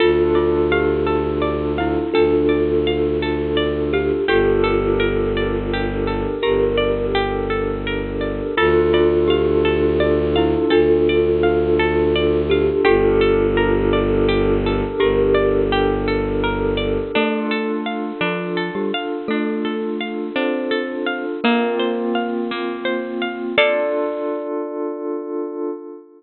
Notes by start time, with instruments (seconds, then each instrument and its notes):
0.00 violin D2, pad 5 (bowed) D4 F4 A4, glockenspiel F4, kalimba F4 A4, orchestral harp A4
0.35 glockenspiel F4, orchestral harp D5
0.72 glockenspiel G4, orchestral harp F5
1.06 orchestral harp A4
1.42 orchestral harp D5
1.78 glockenspiel E4, orchestral harp F5
2.14 violin D2, glockenspiel D4, kalimba F4 A4, orchestral harp A4
2.49 orchestral harp D5
2.87 orchestral harp F5
3.22 orchestral harp A4
3.57 orchestral harp D5
3.93 kalimba G4, orchestral harp F5
4.28 violin G1, pad 5 (bowed) D4 G4 A4 A#4, kalimba F4 A4, orchestral harp G4, glockenspiel G4
4.63 orchestral harp A4
4.99 orchestral harp A#4
5.37 orchestral harp D5
5.73 orchestral harp G4
6.07 orchestral harp A4
6.42 violin G1, kalimba G4 A#4, glockenspiel G4, orchestral harp A#4
6.77 orchestral harp D5
7.15 orchestral harp G4
7.50 orchestral harp A4
7.86 orchestral harp A#4
8.21 orchestral harp D5
8.57 violin D2, pad 5 (bowed) D4 F4 A4, glockenspiel F4, kalimba F4 A4, orchestral harp A4
8.93 glockenspiel F4, orchestral harp D5
9.28 glockenspiel G4, orchestral harp F5
9.65 orchestral harp A4
10.00 orchestral harp D5
10.36 glockenspiel E4, orchestral harp F5
10.70 violin D2, glockenspiel D4, kalimba F4 A4, orchestral harp A4
11.09 orchestral harp D5
11.43 orchestral harp F5
11.79 orchestral harp A4
12.15 orchestral harp D5
12.50 kalimba G4, orchestral harp F5
12.84 violin G1, pad 5 (bowed) D4 G4 A4 A#4, kalimba F4 A4, orchestral harp G4, glockenspiel G4
13.21 orchestral harp A4
13.57 orchestral harp A#4
13.93 orchestral harp D5
14.28 orchestral harp G4
14.66 orchestral harp A4
15.00 violin G1, glockenspiel G4, kalimba G4 A#4, orchestral harp A#4
15.34 orchestral harp D5
15.72 orchestral harp G4
16.07 orchestral harp A4
16.43 orchestral harp A#4
16.77 orchestral harp D5
17.14 glockenspiel A3 A4, pad 5 (bowed) D4 F4 A4, orchestral harp D4
17.51 orchestral harp A4
17.86 orchestral harp F5
18.21 glockenspiel F3 F4, orchestral harp D4
18.57 orchestral harp A4
18.75 glockenspiel G3 G4
18.94 orchestral harp F5
19.28 glockenspiel A3 A4, orchestral harp D4
19.65 orchestral harp A4
20.00 orchestral harp F5
20.36 glockenspiel C4 C5, orchestral harp D4
20.71 orchestral harp A4
21.06 orchestral harp F5
21.43 pad 5 (bowed) A#3 C4 F4, glockenspiel A#3 A#4, orchestral harp A#3
21.79 orchestral harp C5
22.15 orchestral harp F5
22.51 orchestral harp A#3
22.85 orchestral harp C5
23.21 orchestral harp F5
23.57 pad 5 (bowed) D4 F4 A4, orchestral harp A4 D5 F5, glockenspiel D5